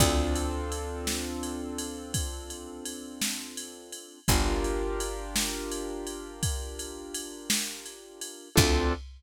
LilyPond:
<<
  \new Staff \with { instrumentName = "Acoustic Grand Piano" } { \time 12/8 \key d \minor \tempo 4. = 56 <c' d' f' a'>1. | <d' f' g' bes'>1. | <c' d' f' a'>4. r1 r8 | }
  \new Staff \with { instrumentName = "Electric Bass (finger)" } { \clef bass \time 12/8 \key d \minor d,1. | g,,1. | d,4. r1 r8 | }
  \new DrumStaff \with { instrumentName = "Drums" } \drummode { \time 12/8 <bd cymr>8 cymr8 cymr8 sn8 cymr8 cymr8 <bd cymr>8 cymr8 cymr8 sn8 cymr8 cymr8 | <bd cymr>8 cymr8 cymr8 sn8 cymr8 cymr8 <bd cymr>8 cymr8 cymr8 sn8 cymr8 cymr8 | <cymc bd>4. r4. r4. r4. | }
>>